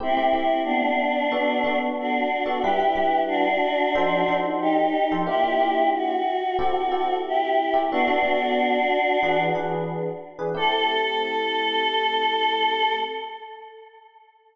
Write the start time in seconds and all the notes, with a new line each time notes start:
0.00 A3 C4 E4 G4
0.17 A3 C4 E4 G4
0.33 A3 C4 E4 G4
0.64 B3 D4
1.32 B3 D4 F#4 A4
1.64 B3 D4 F#4 A4
2.00 D4 F#4
2.46 B3 D4 F#4 A4
2.62 G3 D4 E4 G4 B4
2.80 G3 D4 E4 B4
2.95 G3 D4 E4 B4
3.28 D4 F#4
3.95 F3 D#4 A4 C5
4.28 F3 D#4 A4 C5
4.61 D#4 G4
5.12 F3 D#4 A4 C5
5.27 A#3 D4 E4 F4 G4
5.44 A#3 D4 F4 G4
5.60 A#3 D4 F4 G4
5.94 F#4
6.59 C4 E4 G4 A4
6.92 C4 E4 G4 A4
7.27 E4 G4
7.74 C4 E4 G4 A4
7.91 B3 D4 F#4 A4
8.07 B3 D4 F#4 A4
8.23 B3 D4 F#4 A4
9.23 E3 D4 G#4 B4
9.55 E3 D4 G#4 B4
10.39 E3 D4 G#4 B4
10.55 A3 C4 E4 G4 A4